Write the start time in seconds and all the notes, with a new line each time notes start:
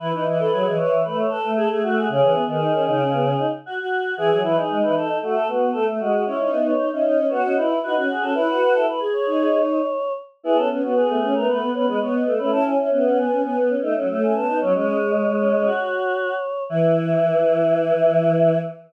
0.00 E3 E4 B4
0.12 E3 D#4 B4
0.25 E3 E4 D#5
0.39 A4 B4
0.51 F#3 G#4
0.65 E3 D#5
0.76 E3 B4 C#5
1.04 A3 B4
1.18 C#5
1.29 A4 B4
1.43 A3
1.56 G#4 A4
1.70 A3 G#4
1.83 A3 F#4
1.97 G#4
2.09 C#3 C#4 G#4
2.22 E3
2.35 B3
2.48 D#3 G#4
2.60 D#4
2.74 C#4
2.87 C#3 D#4
3.00 C#4
3.13 B3
3.25 C#4
3.39 D#4
3.66 F#4
3.80 F#4
4.17 E3 G#4
4.30 F#3 G#4
4.42 E3 E4 B4
4.56 D#4 G#4
4.70 G#3
4.82 E3 B4
4.96 A4
5.22 A3 F#4
5.35 A4
5.48 B3 F#4
5.72 A3 A4
5.87 A3
6.00 G#3 F#4
6.12 F#4
6.26 C#4 E4 C#5
6.38 D#4 C#5
6.50 B3 E5
6.65 C#5
6.78 D#4
6.91 C#4 D#4 E5
7.03 C#4 D#4 D#5
7.18 C#4
7.28 B3 F#4 C#5
7.44 C#4 D#5
7.56 D#4 E4 B4
7.83 D#4 F#4 B4
7.96 C#4 F#4
8.11 G#4
8.22 C#4 A4
8.34 E4 B4
8.48 F#4
8.61 F#4
8.73 E4 A4
8.88 B4
9.00 G#4
9.13 C#5
9.26 D#4
10.43 B3 E4 G#4
10.55 C#4 A4
10.70 B3 C#4
10.83 B3 F#4
10.95 B3 G#4
11.09 A3
11.22 C#4
11.34 A3 B3 A#4
11.47 A3 B4
11.62 B3
11.73 B3 C#4 B4
11.87 G#3 B3 B4
12.00 B3 C#5
12.13 D#5
12.26 A3
12.38 A3 C#4 B4
12.51 C#4 E4 A5
12.65 C#4 G#5
12.77 C#4 E5
12.91 B3 C#4 E5
13.05 C#4 F#5
13.17 B3 G#5
13.30 C#4
13.43 B3 G#5
13.57 B3
13.69 C#4
13.82 A3 D#4
13.96 F#3 C#4
14.09 A3 C#4
14.23 G#5
14.35 B3 A5
14.47 B3 D#4
14.60 F#3 C#4 C#5
14.74 G#3 C#4 C#5
14.86 C#4
15.41 C#4
15.53 C#4
15.65 F#4
16.69 E3 E4 E5